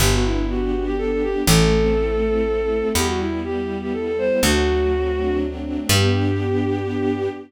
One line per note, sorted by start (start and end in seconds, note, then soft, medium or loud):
0.00 1.35 G1 medium
0.00 0.96 B3 medium
0.00 0.12 G4 medium
0.12 0.24 F#4 medium
0.24 0.72 D4 medium
0.24 0.46 E4 medium
0.49 0.83 F#4 medium
0.49 1.42 G4 medium
0.72 1.23 D4 medium
0.86 0.97 G4 medium
0.97 1.43 B3 medium
0.97 1.10 A4 loud
1.11 1.23 A4 medium
1.23 1.46 D4 medium
1.23 1.43 G4 loud
1.46 2.83 A1 loud
1.46 2.46 A3 loud
1.46 2.88 A4 loud
1.71 2.21 C4 medium
1.96 2.90 E4 medium
2.22 2.69 C4 medium
2.47 2.93 A3 medium
2.69 2.93 C4 medium
2.95 4.31 E2 medium
2.95 3.92 G3 loud
2.95 3.07 G4 loud
3.07 3.19 F#4 medium
3.19 3.68 B3 medium
3.19 3.40 E4 medium
3.44 4.38 E4 medium
3.44 3.77 G4 medium
3.69 4.19 B3 medium
3.81 3.93 G4 medium
3.93 4.40 G3 medium
3.93 4.05 A4 medium
4.06 4.17 A4 medium
4.18 4.43 B3 medium
4.18 4.40 C5 loud
4.43 5.79 D2 medium
4.43 5.83 F#3 loud
4.43 5.36 F#4 loud
4.66 5.64 A3 medium
4.91 5.41 C4 medium
5.17 5.87 D4 medium
5.42 5.88 C4 medium
5.64 5.88 A3 medium
5.89 7.29 G2 loud
5.89 7.29 B3 loud
5.89 7.29 D4 loud
5.89 7.29 G4 loud
5.89 7.30 G4 loud